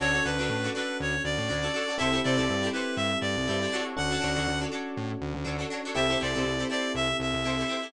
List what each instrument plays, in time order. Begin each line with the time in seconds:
0.00 synth bass 1 D2, electric piano 1 C#4 D4 F#4 A4, acoustic guitar (steel) D4 F#4 A4 C#5, clarinet C#5
0.13 acoustic guitar (steel) D4 F#4 A4 C#5
0.24 synth bass 1 D2, acoustic guitar (steel) D4 F#4 A4 C#5, clarinet B4
0.39 synth bass 1 D2, acoustic guitar (steel) D4 F#4 A4 C#5
0.50 synth bass 1 A2
0.64 acoustic guitar (steel) D4 F#4 A4 C#5
0.75 acoustic guitar (steel) D4 F#4 A4 C#5, clarinet B4
1.00 synth bass 1 D2, clarinet C#5
1.24 synth bass 1 D2, clarinet D5
1.38 synth bass 1 A2
1.49 synth bass 1 D2, acoustic guitar (steel) D4 F#4 A4 C#5
1.63 acoustic guitar (steel) D4 F#4 A4 C#5
1.74 acoustic guitar (steel) D4 F#4 A4 C#5
1.88 acoustic guitar (steel) D4 F#4 A4 C#5
1.98 synth bass 1 C2, electric piano 1 C4 E4 G4 A4, acoustic guitar (steel) E4 G4 A4, clarinet E5
2.02 acoustic guitar (steel) C5
2.13 acoustic guitar (steel) E4 G4 A4 C5
2.24 synth bass 1 C3, acoustic guitar (steel) E4 G4 A4 C5, clarinet D5
2.37 synth bass 1 C2, acoustic guitar (steel) E4 G4 A4 C5
2.50 synth bass 1 G2
2.63 acoustic guitar (steel) E4 G4 A4 C5
2.73 acoustic guitar (steel) E4 G4 A4 C5, clarinet B4
2.96 synth bass 1 G2, clarinet E5
3.21 synth bass 1 G2, clarinet D5
3.37 synth bass 1 C2
3.48 synth bass 1 G2, acoustic guitar (steel) E4 G4 A4 C5
3.62 acoustic guitar (steel) E4 G4 A4 C5
3.72 acoustic guitar (steel) D4 F#4 A4 C#5
3.97 synth bass 1 D2, electric piano 1 C#4 D4 F#4 A4, clarinet F#5
4.11 acoustic guitar (steel) D4 F#4 A4 C#5
4.21 synth bass 1 D2, acoustic guitar (steel) D4 F#4 A4 C#5
4.35 synth bass 1 D2, acoustic guitar (steel) D4 F#4 A4 C#5
4.48 synth bass 1 D2
4.61 acoustic guitar (steel) D4 F#4 A4 C#5
4.72 acoustic guitar (steel) D4 F#4 A4 C#5
4.97 synth bass 1 A2
5.21 synth bass 1 D2
5.34 synth bass 1 D2
5.45 synth bass 1 D2, acoustic guitar (steel) D4 F#4 A4 C#5
5.59 acoustic guitar (steel) D4 F#4 A4 C#5
5.70 acoustic guitar (steel) D4 F#4 A4 C#5
5.85 acoustic guitar (steel) D4 F#4 A4 C#5
5.95 synth bass 1 C2, electric piano 1 C4 E4 G4 A4, acoustic guitar (steel) E4 G4 A4 C5, clarinet E5
6.09 acoustic guitar (steel) E4 G4 A4 C5
6.20 synth bass 1 C2, acoustic guitar (steel) E4 G4 A4 C5, clarinet D5
6.35 synth bass 1 C2, acoustic guitar (steel) E4 G4 A4 C5
6.45 synth bass 1 C2
6.59 acoustic guitar (steel) E4 G4 A4 C5
6.70 acoustic guitar (steel) E4 G4 A4 C5, clarinet D5
6.95 synth bass 1 C2, clarinet E5
7.20 synth bass 1 C2, clarinet E5
7.34 synth bass 1 C2
7.44 synth bass 1 C2, acoustic guitar (steel) E4 G4 A4 C5
7.59 acoustic guitar (steel) E4 G4 A4 C5
7.68 acoustic guitar (steel) E4 G4 A4 C5
7.82 acoustic guitar (steel) E4 G4 A4 C5